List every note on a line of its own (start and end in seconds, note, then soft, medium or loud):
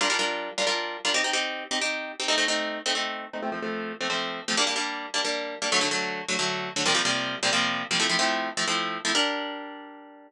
0.01 0.08 G3 loud
0.01 0.08 D4 medium
0.01 0.08 F4 medium
0.01 0.08 A#4 medium
0.10 0.17 G3 medium
0.10 0.17 D4 medium
0.10 0.17 F4 medium
0.10 0.17 A#4 medium
0.19 0.50 G3 medium
0.19 0.50 D4 medium
0.19 0.50 F4 medium
0.19 0.50 A#4 medium
0.58 0.65 G3 medium
0.58 0.65 D4 medium
0.58 0.65 F4 medium
0.58 0.65 A#4 medium
0.67 0.97 G3 medium
0.67 0.97 D4 medium
0.67 0.97 F4 medium
0.67 0.97 A#4 medium
1.05 1.12 G3 medium
1.05 1.12 D4 medium
1.05 1.12 F4 medium
1.05 1.12 A#4 medium
1.14 1.22 C4 medium
1.14 1.22 D#4 loud
1.14 1.22 G4 medium
1.24 1.32 C4 medium
1.24 1.32 D#4 medium
1.24 1.32 G4 medium
1.33 1.64 C4 medium
1.33 1.64 D#4 medium
1.33 1.64 G4 medium
1.71 1.79 C4 medium
1.71 1.79 D#4 medium
1.71 1.79 G4 medium
1.81 2.12 C4 medium
1.81 2.12 D#4 medium
1.81 2.12 G4 medium
2.20 2.27 C4 medium
2.20 2.27 D#4 medium
2.20 2.27 G4 medium
2.28 2.36 A3 medium
2.28 2.36 C4 medium
2.28 2.36 D#4 medium
2.38 2.45 A3 medium
2.38 2.45 C4 medium
2.38 2.45 D#4 medium
2.48 2.79 A3 medium
2.48 2.79 C4 medium
2.48 2.79 D#4 medium
2.86 2.93 A3 medium
2.86 2.93 C4 medium
2.86 2.93 D#4 medium
2.95 3.25 A3 medium
2.95 3.25 C4 medium
2.95 3.25 D#4 medium
3.33 3.41 A3 medium
3.33 3.41 C4 medium
3.33 3.41 D#4 medium
3.42 3.50 F3 medium
3.42 3.50 A3 loud
3.42 3.50 C4 medium
3.52 3.60 F3 medium
3.52 3.60 A3 medium
3.52 3.60 C4 medium
3.62 3.93 F3 medium
3.62 3.93 A3 medium
3.62 3.93 C4 medium
4.01 4.08 F3 medium
4.01 4.08 A3 medium
4.01 4.08 C4 medium
4.10 4.40 F3 medium
4.10 4.40 A3 medium
4.10 4.40 C4 medium
4.48 4.56 F3 medium
4.48 4.56 A3 medium
4.48 4.56 C4 medium
4.57 4.65 G3 medium
4.57 4.65 A#3 medium
4.57 4.65 D4 loud
4.67 4.74 G3 medium
4.67 4.74 A#3 medium
4.67 4.74 D4 medium
4.76 5.06 G3 medium
4.76 5.06 A#3 medium
4.76 5.06 D4 medium
5.14 5.22 G3 medium
5.14 5.22 A#3 medium
5.14 5.22 D4 medium
5.25 5.55 G3 medium
5.25 5.55 A#3 medium
5.25 5.55 D4 medium
5.62 5.69 G3 medium
5.62 5.69 A#3 medium
5.62 5.69 D4 medium
5.72 5.80 D3 medium
5.72 5.80 F#3 medium
5.72 5.80 A3 medium
5.81 5.89 D3 medium
5.81 5.89 F#3 medium
5.81 5.89 A3 medium
5.91 6.22 D3 medium
5.91 6.22 F#3 medium
5.91 6.22 A3 medium
6.28 6.36 D3 medium
6.28 6.36 F#3 medium
6.28 6.36 A3 medium
6.39 6.69 D3 medium
6.39 6.69 F#3 medium
6.39 6.69 A3 medium
6.76 6.84 D3 medium
6.76 6.84 F#3 medium
6.76 6.84 A3 medium
6.86 6.93 C3 medium
6.86 6.93 F3 medium
6.86 6.93 G3 medium
6.86 6.93 A#3 medium
6.94 7.02 C3 medium
6.94 7.02 F3 medium
6.94 7.02 G3 medium
6.94 7.02 A#3 medium
7.05 7.36 C3 medium
7.05 7.36 F3 medium
7.05 7.36 G3 medium
7.05 7.36 A#3 medium
7.43 7.50 C3 medium
7.43 7.50 F3 medium
7.43 7.50 G3 medium
7.43 7.50 A#3 medium
7.53 7.83 C3 medium
7.53 7.83 F3 medium
7.53 7.83 G3 medium
7.53 7.83 A#3 medium
7.91 7.98 C3 medium
7.91 7.98 F3 medium
7.91 7.98 G3 medium
7.91 7.98 A#3 medium
8.00 8.07 F3 medium
8.00 8.07 A3 medium
8.00 8.07 C4 medium
8.00 8.07 E4 medium
8.09 8.17 F3 medium
8.09 8.17 A3 medium
8.09 8.17 C4 medium
8.09 8.17 E4 medium
8.19 8.49 F3 medium
8.19 8.49 A3 medium
8.19 8.49 C4 medium
8.19 8.49 E4 medium
8.57 8.65 F3 medium
8.57 8.65 A3 medium
8.57 8.65 C4 medium
8.57 8.65 E4 medium
8.67 8.98 F3 medium
8.67 8.98 A3 medium
8.67 8.98 C4 medium
8.67 8.98 E4 medium
9.05 9.12 F3 medium
9.05 9.12 A3 medium
9.05 9.12 C4 medium
9.05 9.12 E4 medium
9.15 10.28 G3 medium
9.15 10.28 D4 loud
9.15 10.28 A#4 loud